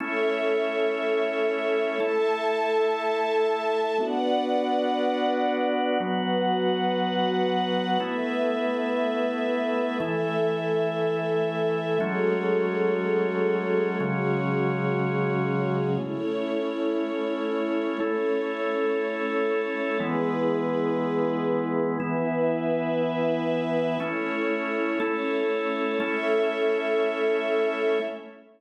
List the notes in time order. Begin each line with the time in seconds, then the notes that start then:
0.00 A3 C#4 E4 A4 C#5 E5
2.00 A3 E4 A4 E5 A5
4.00 B3 D4 F#4 B4 D5 F#5
6.00 F#3 B3 F#4 B4 F#5
8.00 A3 B3 E4 B4 E5
10.00 E3 A3 E4 A4 E5
12.00 F#3 G#3 A3 C#4 F#4 G#4 A4 C#5
14.00 C#3 F#3 G#3 C#4 F#4 G#4 C#5
16.00 A3 C#4 E4 C#5
18.00 A3 C#4 E4 A4 C#5
20.00 E3 G#3 B3 E4 G#4 B4
22.00 E3 B3 E4 B4 E5
24.00 A3 C#4 E4 C#5
25.00 A3 C#4 E4 A4 C#5
26.00 A3 C#4 E4 A4 C#5 E5